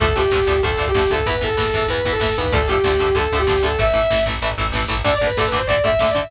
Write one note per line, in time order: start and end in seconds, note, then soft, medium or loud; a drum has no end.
0.00 0.13 D2 medium
0.00 0.06 D3 loud
0.00 0.06 F3 loud
0.00 0.06 A3 loud
0.00 0.14 A4 medium
0.00 kick medium
0.00 closed hi-hat medium
0.08 kick medium
0.15 0.31 D2 medium
0.15 0.22 D3 medium
0.15 0.22 F3 loud
0.15 0.22 A3 loud
0.15 0.57 G4 medium
0.15 kick medium
0.15 closed hi-hat medium
0.23 kick medium
0.31 0.45 D2 medium
0.31 0.38 D3 loud
0.31 0.38 F3 medium
0.31 0.38 A3 loud
0.31 kick medium
0.31 snare medium
0.39 kick medium
0.47 0.61 D2 medium
0.47 0.53 D3 loud
0.47 0.53 F3 medium
0.47 0.53 A3 medium
0.47 kick medium
0.47 closed hi-hat medium
0.55 kick medium
0.63 0.77 D2 medium
0.63 0.69 D3 medium
0.63 0.69 F3 medium
0.63 0.69 A3 medium
0.63 0.84 A4 medium
0.63 kick medium
0.63 closed hi-hat medium
0.71 kick medium
0.77 0.91 D2 medium
0.77 0.85 D3 medium
0.77 0.85 F3 medium
0.77 0.85 A3 medium
0.77 kick medium
0.87 1.10 G4 medium
0.87 kick medium
0.94 1.08 D2 medium
0.94 1.01 D3 loud
0.94 1.01 F3 medium
0.94 1.01 A3 medium
0.94 kick medium
0.94 snare medium
0.94 closed hi-hat medium
1.03 kick medium
1.10 1.24 D2 medium
1.10 1.17 D3 medium
1.10 1.17 F3 medium
1.10 1.17 A3 medium
1.10 1.25 A4 medium
1.10 kick medium
1.10 closed hi-hat medium
1.18 kick medium
1.26 1.40 E2 medium
1.26 1.33 E3 loud
1.26 1.33 B3 loud
1.26 1.42 B4 medium
1.26 kick medium
1.26 closed hi-hat medium
1.34 kick medium
1.41 1.56 E2 medium
1.41 1.47 E3 medium
1.41 1.47 B3 medium
1.41 1.84 A4 medium
1.41 kick medium
1.41 closed hi-hat medium
1.50 kick medium
1.57 1.71 E2 medium
1.57 1.63 E3 loud
1.57 1.63 B3 medium
1.57 kick medium
1.57 snare medium
1.65 kick medium
1.73 1.87 E2 medium
1.73 1.81 E3 medium
1.73 1.81 B3 medium
1.73 kick medium
1.73 closed hi-hat medium
1.82 kick medium
1.88 2.02 E2 medium
1.88 1.97 E3 medium
1.88 1.97 B3 medium
1.88 2.10 B4 medium
1.88 kick medium
1.88 closed hi-hat medium
1.97 kick medium
2.05 2.19 E2 medium
2.05 2.12 E3 medium
2.05 2.12 B3 loud
2.05 kick medium
2.05 closed hi-hat medium
2.12 2.32 A4 medium
2.12 kick medium
2.20 2.34 E2 medium
2.20 2.27 E3 medium
2.20 2.27 B3 medium
2.20 kick medium
2.20 snare medium
2.29 kick medium
2.37 2.52 D#2 medium
2.37 2.44 E3 medium
2.37 2.44 B3 loud
2.37 2.53 B4 medium
2.37 kick medium
2.37 closed hi-hat medium
2.44 kick medium
2.52 2.66 D2 medium
2.52 2.59 D3 loud
2.52 2.59 F3 loud
2.52 2.59 A3 loud
2.52 2.68 A4 medium
2.52 kick medium
2.52 closed hi-hat medium
2.61 kick medium
2.67 2.82 D2 medium
2.67 2.76 D3 medium
2.67 2.76 F3 medium
2.67 2.76 A3 medium
2.67 3.12 G4 medium
2.67 kick medium
2.67 closed hi-hat medium
2.76 kick medium
2.84 2.98 D2 medium
2.84 2.91 D3 loud
2.84 2.91 F3 medium
2.84 2.91 A3 medium
2.84 kick medium
2.84 snare medium
2.92 kick medium
2.99 3.13 D2 medium
2.99 3.06 D3 medium
2.99 3.06 F3 medium
2.99 3.06 A3 medium
2.99 kick medium
2.99 closed hi-hat medium
3.08 kick medium
3.15 3.28 D2 medium
3.15 3.22 D3 loud
3.15 3.22 F3 medium
3.15 3.22 A3 medium
3.15 3.34 A4 medium
3.15 kick medium
3.15 closed hi-hat medium
3.23 kick medium
3.32 3.46 D2 medium
3.32 3.39 D3 loud
3.32 3.39 F3 medium
3.32 3.39 A3 medium
3.32 kick medium
3.32 closed hi-hat soft
3.39 3.61 G4 medium
3.39 kick medium
3.47 3.62 D2 medium
3.47 3.53 D3 medium
3.47 3.53 F3 medium
3.47 3.53 A3 medium
3.47 kick medium
3.47 snare medium
3.55 kick medium
3.62 3.76 D2 medium
3.62 3.69 D3 loud
3.62 3.69 F3 medium
3.62 3.69 A3 loud
3.62 3.79 A4 medium
3.62 kick medium
3.62 closed hi-hat medium
3.71 kick medium
3.79 3.93 A1 medium
3.79 3.85 E3 loud
3.79 3.85 A3 loud
3.79 4.19 E5 medium
3.79 kick medium
3.79 closed hi-hat medium
3.87 kick medium
3.93 4.07 A1 medium
3.93 4.00 E3 loud
3.93 4.00 A3 loud
3.93 kick medium
3.93 closed hi-hat medium
4.02 kick medium
4.10 4.24 A1 medium
4.10 4.17 E3 medium
4.10 4.17 A3 medium
4.10 kick medium
4.10 snare medium
4.18 kick medium
4.26 4.39 A1 medium
4.26 4.33 E3 loud
4.26 4.33 A3 medium
4.26 kick medium
4.26 closed hi-hat medium
4.34 kick medium
4.42 4.55 A1 medium
4.42 4.49 E3 loud
4.42 4.49 A3 loud
4.42 kick soft
4.42 closed hi-hat medium
4.50 kick medium
4.57 4.72 A1 medium
4.57 4.64 E3 medium
4.57 4.64 A3 medium
4.57 kick medium
4.57 closed hi-hat medium
4.65 kick medium
4.72 4.86 A1 medium
4.72 4.81 E3 loud
4.72 4.81 A3 medium
4.72 kick medium
4.72 snare medium
4.82 kick medium
4.88 5.02 A1 medium
4.88 4.95 E3 loud
4.88 4.95 A3 loud
4.88 kick medium
4.88 closed hi-hat medium
4.97 kick medium
5.04 5.11 D2 loud
5.04 5.11 D3 loud
5.04 5.11 A3 loud
5.04 5.14 D5 medium
5.04 kick medium
5.04 crash medium
5.13 5.24 D5 medium
5.13 kick medium
5.20 5.28 D2 loud
5.20 5.28 D3 medium
5.20 5.28 A3 medium
5.20 kick medium
5.20 ride medium
5.27 5.37 B4 medium
5.27 kick medium
5.37 5.44 D2 loud
5.37 5.44 D3 loud
5.37 5.44 A3 loud
5.37 5.47 A4 medium
5.37 kick medium
5.37 snare medium
5.44 5.58 B4 medium
5.44 kick medium
5.52 5.58 D2 loud
5.52 5.58 D3 loud
5.52 5.58 A3 medium
5.52 kick medium
5.52 ride medium
5.58 5.68 C5 medium
5.58 kick medium
5.67 5.75 D2 loud
5.67 5.75 D3 medium
5.67 5.75 A3 loud
5.67 5.80 D5 medium
5.67 kick medium
5.67 ride medium
5.77 kick medium
5.84 5.90 D2 loud
5.84 5.90 D3 loud
5.84 5.90 A3 loud
5.84 5.99 E5 medium
5.84 kick medium
5.84 ride medium
5.92 kick medium
5.99 6.07 D2 loud
5.99 6.07 D3 loud
5.99 6.07 A3 loud
5.99 6.09 E5 medium
5.99 kick medium
5.99 snare medium
6.08 6.20 D5 medium
6.08 kick medium
6.15 6.21 D2 loud
6.15 6.21 D3 loud
6.15 6.21 A3 medium
6.15 kick medium
6.15 ride medium
6.22 6.31 E5 medium
6.22 kick medium